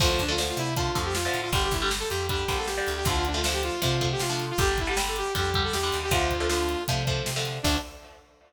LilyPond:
<<
  \new Staff \with { instrumentName = "Lead 2 (sawtooth)" } { \time 4/4 \key d \minor \tempo 4 = 157 f'16 f'16 d'16 f'16 r16 f'16 e'8 f'8. g'16 f'8. f'16 | g'16 g'16 e'16 g'16 r16 a'16 g'8 g'8. a'16 g'8. g'16 | f'16 f'16 d'16 f'16 r16 g'16 f'8 f'8. g'16 f'8. f'16 | g'16 g'16 e'16 g'16 r16 a'16 g'8 g'8. a'16 g'8. g'16 |
f'2 r2 | d'4 r2. | }
  \new Staff \with { instrumentName = "Overdriven Guitar" } { \time 4/4 \key d \minor <d f a>8. <d f a>16 <d f a>4 <d f a>8 <d f a>8. <d f a>8. | <d g>8. <d g>16 <d g>4 <d g>8 <d g>8. <d g>8. | <d f a>8. <d f a>16 <d f a>4 <d f a>8 <d f a>8. <d f a>8. | <d g>8. <d g>16 <d g>4 <d g>8 <d g>8. <d g>8. |
<d f a>8. <d f a>16 <d f a>4 <d f a>8 <d f a>8. <d f a>8. | <d f a>4 r2. | }
  \new Staff \with { instrumentName = "Electric Bass (finger)" } { \clef bass \time 4/4 \key d \minor d,8 d,4 c4 f,4 a,8 | g,,8 g,,4 f,4 bes,,4 d,8 | d,2 c4 c4 | g,,2 f,4 e,8 ees,8 |
d,2 c4 c4 | d,4 r2. | }
  \new DrumStaff \with { instrumentName = "Drums" } \drummode { \time 4/4 <cymc bd>8 <hh bd>8 sn8 hh8 <hh bd>8 <hh bd>8 sn8 hh8 | <hh bd>8 <hh bd>8 sn8 hh8 <hh bd>8 <hh bd>8 sn8 hh8 | <hh bd>8 hh8 sn8 hh8 <hh bd>8 <hh bd>8 sn8 hh8 | <hh bd>8 <hh bd>8 sn8 hh8 <hh bd>8 <hh bd>8 sn8 hh8 |
<hh bd>8 <hh bd>8 sn8 hh8 <hh bd>8 <hh bd>8 sn8 hh8 | <cymc bd>4 r4 r4 r4 | }
>>